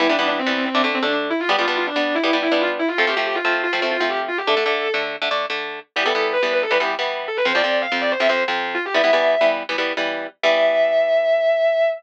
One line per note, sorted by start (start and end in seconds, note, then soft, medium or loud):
0.00 0.07 E3 medium
0.00 0.07 G3 loud
0.00 0.07 B3 medium
0.00 0.08 E4 loud
0.09 0.17 E3 medium
0.09 0.17 G3 medium
0.09 0.17 B3 medium
0.09 0.18 D4 medium
0.18 0.41 E3 medium
0.18 0.41 G3 medium
0.18 0.41 B3 medium
0.18 0.27 D4 medium
0.28 0.37 D4 medium
0.39 0.65 C4 medium
0.47 0.69 E3 medium
0.47 0.69 G3 medium
0.47 0.69 B3 medium
0.65 0.82 C4 medium
0.75 0.82 D3 loud
0.75 0.82 A3 medium
0.75 0.82 D4 loud
0.84 0.99 D3 medium
0.84 0.99 A3 medium
0.84 0.99 D4 medium
0.94 1.03 C4 medium
1.02 1.32 D3 medium
1.02 1.32 A3 medium
1.02 1.32 D4 medium
1.02 1.12 D4 medium
1.12 1.21 D4 medium
1.30 1.39 E4 medium
1.40 1.49 F4 loud
1.49 1.56 G3 loud
1.49 1.56 B3 loud
1.49 1.56 D4 loud
1.49 1.58 G4 loud
1.58 1.66 G3 medium
1.58 1.66 B3 medium
1.58 1.66 D4 medium
1.58 1.67 F4 medium
1.68 1.90 G3 medium
1.68 1.90 B3 medium
1.68 1.90 D4 medium
1.68 1.76 F4 medium
1.77 1.86 F4 medium
1.87 2.14 D4 medium
1.96 2.18 G3 medium
1.96 2.18 B3 medium
1.96 2.18 D4 medium
2.15 2.31 E4 medium
2.24 2.31 G3 loud
2.24 2.31 B3 medium
2.24 2.31 D4 medium
2.33 2.48 G3 medium
2.33 2.48 B3 medium
2.33 2.48 D4 medium
2.42 2.51 E4 medium
2.52 2.81 G3 medium
2.52 2.81 B3 medium
2.52 2.81 D4 medium
2.52 2.60 E4 medium
2.61 2.69 F4 medium
2.79 2.88 E4 medium
2.88 2.97 F4 medium
2.98 3.06 F3 loud
2.98 3.06 A3 loud
2.98 3.06 C4 medium
2.98 3.07 A4 loud
3.07 3.15 F3 medium
3.07 3.15 A3 medium
3.07 3.15 C4 medium
3.07 3.17 G4 medium
3.17 3.39 F3 medium
3.17 3.39 A3 medium
3.17 3.39 C4 medium
3.17 3.26 G4 medium
3.26 3.35 G4 medium
3.35 3.59 F4 medium
3.45 3.67 F3 medium
3.45 3.67 A3 medium
3.45 3.67 C4 medium
3.63 3.80 F4 medium
3.73 3.80 F3 medium
3.73 3.80 A3 medium
3.73 3.80 C4 medium
3.82 3.97 F3 medium
3.82 3.97 A3 medium
3.82 3.97 C4 medium
3.91 4.00 F4 medium
4.00 4.30 F3 medium
4.00 4.30 A3 medium
4.00 4.30 C4 medium
4.00 4.09 F4 medium
4.09 4.18 G4 medium
4.28 4.37 F4 medium
4.38 4.47 G4 medium
4.47 4.55 D3 medium
4.47 4.55 A3 loud
4.47 4.55 D4 loud
4.47 4.95 A4 medium
4.57 4.64 D3 medium
4.57 4.64 A3 medium
4.57 4.64 D4 medium
4.66 4.88 D3 medium
4.66 4.88 A3 medium
4.66 4.88 D4 medium
4.94 5.16 D3 medium
4.94 5.16 A3 medium
4.94 5.16 D4 medium
5.22 5.29 D3 medium
5.22 5.29 A3 medium
5.22 5.29 D4 medium
5.31 5.46 D3 medium
5.31 5.46 A3 medium
5.31 5.46 D4 medium
5.50 5.80 D3 medium
5.50 5.80 A3 medium
5.50 5.80 D4 medium
5.96 6.04 E3 medium
5.96 6.04 G3 loud
5.96 6.04 B3 medium
5.96 6.05 G4 medium
6.06 6.13 E3 medium
6.06 6.13 G3 loud
6.06 6.13 B3 medium
6.06 6.29 A4 medium
6.15 6.37 E3 medium
6.15 6.37 G3 medium
6.15 6.37 B3 medium
6.33 6.51 B4 loud
6.43 6.65 E3 medium
6.43 6.65 G3 medium
6.43 6.65 B3 medium
6.53 6.62 B4 medium
6.62 6.71 A4 medium
6.71 6.78 E3 medium
6.71 6.78 G3 medium
6.71 6.78 B3 medium
6.71 6.80 B4 medium
6.80 6.95 E3 medium
6.80 6.95 G3 medium
6.80 6.95 B3 medium
6.80 6.89 G4 medium
6.99 7.28 E3 medium
6.99 7.28 G3 medium
6.99 7.28 B3 medium
7.28 7.37 A4 medium
7.37 7.46 B4 medium
7.45 7.53 F2 loud
7.45 7.53 F3 medium
7.45 7.53 C4 medium
7.45 7.55 C5 medium
7.55 7.62 F2 medium
7.55 7.62 F3 medium
7.55 7.62 C4 loud
7.55 7.78 D5 medium
7.64 7.86 F2 medium
7.64 7.86 F3 medium
7.64 7.86 C4 medium
7.82 7.99 F5 medium
7.92 8.14 F2 medium
7.92 8.14 F3 medium
7.92 8.14 C4 medium
8.01 8.10 D5 medium
8.11 8.20 C5 medium
8.20 8.27 F2 medium
8.20 8.27 F3 medium
8.20 8.27 C4 medium
8.20 8.29 E5 medium
8.29 8.44 F2 medium
8.29 8.44 F3 medium
8.29 8.44 C4 medium
8.29 8.38 C5 medium
8.48 8.78 F2 medium
8.48 8.78 F3 medium
8.48 8.78 C4 medium
8.75 8.83 F4 medium
8.85 8.94 G4 medium
8.94 9.02 E3 loud
8.94 9.02 G3 loud
8.94 9.02 B3 loud
8.94 9.43 E5 medium
9.04 9.11 E3 medium
9.04 9.11 G3 medium
9.04 9.11 B3 medium
9.13 9.35 E3 medium
9.13 9.35 G3 medium
9.13 9.35 B3 medium
9.41 9.63 E3 medium
9.41 9.63 G3 medium
9.41 9.63 B3 medium
9.69 9.76 E3 medium
9.69 9.76 G3 medium
9.69 9.76 B3 medium
9.78 9.93 E3 medium
9.78 9.93 G3 medium
9.78 9.93 B3 medium
9.97 10.27 E3 medium
9.97 10.27 G3 medium
9.97 10.27 B3 medium
10.43 11.86 E3 medium
10.43 11.86 G3 loud
10.43 11.86 B3 medium
10.43 11.86 E5 loud